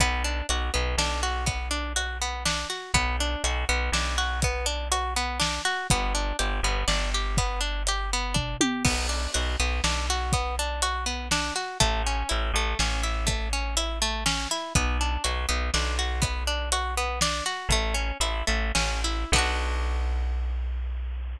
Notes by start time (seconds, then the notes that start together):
0.00 B1 B3, kick, closed hi-hat
0.24 D4
0.49 B1 F#4, closed hi-hat
0.74 B1 B3
0.98 B1 D4, snare
1.23 F#4
1.46 B3, kick, closed hi-hat
1.71 D4
1.96 F#4, closed hi-hat
2.22 B3
2.45 D4, snare
2.70 F#4
2.94 B1 B3, kick, closed hi-hat
3.20 D4
3.44 B1 F#4, closed hi-hat
3.69 B1 B3
3.92 B1 D4, snare
4.18 F#4
4.42 B3, kick, closed hi-hat
4.66 D4
4.92 F#4, closed hi-hat
5.16 B3
5.40 D4, snare
5.65 F#4
5.90 G1 B3, kick, closed hi-hat
6.15 D4
6.39 G1 G4, closed hi-hat
6.63 G1 B3
6.88 G1 D4, snare
7.14 G4
7.37 B3, kick, closed hi-hat
7.61 D4
7.87 G4, closed hi-hat
8.13 B3
8.34 D4, kick, floor tom
8.61 G4, high tom
8.85 B1 B3, kick, crash
9.09 D4
9.34 B1 F#4, closed hi-hat
9.60 B1 B3
9.84 B1 D4, snare
10.10 F#4
10.33 B3, kick, closed hi-hat
10.59 D4
10.82 F#4, closed hi-hat
11.06 B3
11.31 D4, snare
11.56 F#4
11.80 A1 A3, kick, closed hi-hat
12.07 C#4
12.29 A1 E4, closed hi-hat
12.53 A1 A3
12.79 A1 C#4, snare
13.03 E4
13.27 A3, kick, closed hi-hat
13.53 C#4
13.77 E4, closed hi-hat
14.02 A3
14.26 C#4, snare
14.51 E4
14.75 B1 B3, kick, closed hi-hat
15.01 D4
15.24 B1 F#4, closed hi-hat
15.49 B1 B3
15.74 B1 D4, snare
15.99 F#4
16.22 B3, kick, closed hi-hat
16.47 D4
16.72 F#4, closed hi-hat
16.97 B3
17.21 D4, snare
17.46 F#4
17.69 A1 A3, kick, closed hi-hat
17.94 C#4
18.20 A1 E4, closed hi-hat
18.47 A1 A3
18.75 A1 C#4, snare
19.04 E4
19.32 B1 B3 D4, kick, crash
19.38 F#4